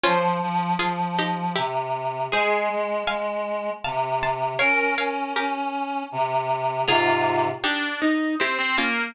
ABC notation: X:1
M:3/4
L:1/16
Q:1/4=79
K:Fm
V:1 name="Pizzicato Strings"
[DF]4 [FA]2 [EG]2 [=EG]4 | [Ac]4 [fa]4 [f=a]2 [ac']2 | [df]2 [df]2 [GB]6 z2 | [FA]4 [EG]4 [=EG]2 [DF]2 |]
V:2 name="Pizzicato Strings"
c12 | A12 | B8 z4 | F4 =D2 E2 C C B,2 |]
V:3 name="Clarinet"
F,2 F,2 F,4 C,4 | A,2 A,2 A,4 C,4 | D2 D2 D4 C,4 | [A,,C,]4 z8 |]